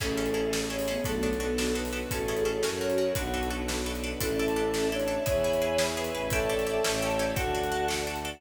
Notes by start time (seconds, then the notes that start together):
0.00 A1 A3 C#4 E4 G#4 A4, kick, crash
0.17 C#4 E4 G#4 A4
0.26 closed hi-hat
0.34 C#4 E4 G#4 A4
0.53 C#4 E4 G#4 A4, snare
0.70 C#4 E4 G#4 A4 C#5
0.79 open hi-hat
0.88 B3 C#4 E4 G#4 A4
1.04 B1 F#3 A3 B3 D4 F#4 A4, kick, closed hi-hat
1.23 B3 D4 F#4 A4
1.33 closed hi-hat
1.40 B3 D4 F#4 A4
1.58 B3 D4 F#4 A4, snare
1.75 B3 D4 F#4 A4 B4
1.85 open hi-hat
1.93 B3 D4 F#4 A4
2.11 A1 C#4 E4 F#4 G#4 A4, kick, closed hi-hat
2.28 C#4 E4 G#4 A4
2.37 closed hi-hat
2.45 C#4 E4 G#4 A4
2.62 F#2 C#4 F#4 A#4, snare
2.81 C#4 F#4 A#4 C#5
2.90 closed hi-hat
2.98 C#4 F#4 A#4
3.15 B1 D4 F#4 A4 B4, kick, closed hi-hat
3.34 D4 F#4 A4 B4
3.43 closed hi-hat
3.50 D4 F#4 A4 B4
3.68 D4 F#4 A4 B4, snare
3.86 D4 F#4 A4 B4
3.95 closed hi-hat
4.04 D4 F#4 A4 B4
4.20 A1 C#4 D4 E4 A4 D5 E5 A5, kick, closed hi-hat
4.39 D4 E4 A4
4.48 closed hi-hat
4.56 D4 E4 A4
4.74 D4 E4 A4, snare
4.91 D4 E4 A4 C#5
4.99 closed hi-hat
5.08 D4 E4 A4
5.26 E2 E4 G#4 B4 C#5 E5 G#5 B5, kick, closed hi-hat
5.44 E4 G#4 B4
5.53 closed hi-hat
5.62 E4 G#4 B4
5.78 E4 G#4 B4, snare
5.97 E4 G#4 B4
6.04 closed hi-hat
6.13 A1 E4 G#4 B4
6.30 D4 E4 G4 A4 C#5 D5 E5 G5 A5, kick, closed hi-hat
6.49 D4 E4 G4 A4
6.59 closed hi-hat
6.67 D4 E4 G4 A4
6.84 A1 C#4 E4 G4 A4 C#5 E5 G5 A5, snare
7.02 C#4 E4 G4 A4 C#5
7.10 closed hi-hat
7.19 C#4 E4 G4 A4 D5
7.35 D2 D4 F#4 A4 D5 F#5 A5, kick, closed hi-hat
7.55 D4 F#4 A4
7.63 closed hi-hat
7.72 D4 F#4 A4
7.88 D4 F#4 A4, snare
8.07 D4 F#4 A4
8.16 closed hi-hat
8.25 D4 F#4 A4